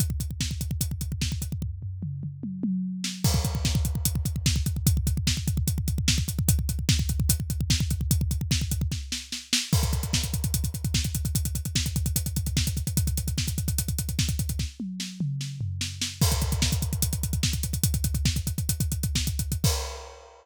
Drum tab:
CC |----------------|----------------|x---------------|----------------|
HH |x-x---x-x-x---x-|----------------|--x---x-x-x---x-|x-x---x-x-x---x-|
SD |----o-------o---|--------------o-|----o-------o---|----o-------o---|
T1 |----------------|--------o-o-----|----------------|----------------|
T2 |----------------|----o-o---------|----------------|----------------|
FT |----------------|o-o-------------|----------------|----------------|
BD |oooooooooooooooo|o---------------|oooooooooooooooo|oooooooooooooooo|

CC |----------------|----------------|x---------------|----------------|
HH |x-x---x-x-x---x-|x-x---x---------|-xxx-xxxxxxx-xxx|xxxx-xxxxxxx-xxx|
SD |----o-------o---|----o---o-o-o-o-|----o-------o---|----o-------o---|
T1 |----------------|----------------|----------------|----------------|
T2 |----------------|----------------|----------------|----------------|
FT |----------------|----------------|----------------|----------------|
BD |oooooooooooooooo|ooooooooo-------|oooooooooooooooo|oooooooooooooooo|

CC |----------------|----------------|x---------------|----------------|
HH |xxxx-xxxxxxx-xxx|----------------|-xxx-xxxxxxx-xxx|xxxx-xxxxxxx-xxx|
SD |----o-------o---|o---o---o---o-o-|----o-------o---|----o-------o---|
T1 |----------------|--o-------------|----------------|----------------|
T2 |----------------|------o---------|----------------|----------------|
FT |----------------|----------o-----|----------------|----------------|
BD |oooooooooooooooo|o---------------|oooooooooooooooo|oooooooooooooooo|

CC |x---------------|
HH |----------------|
SD |----------------|
T1 |----------------|
T2 |----------------|
FT |----------------|
BD |o---------------|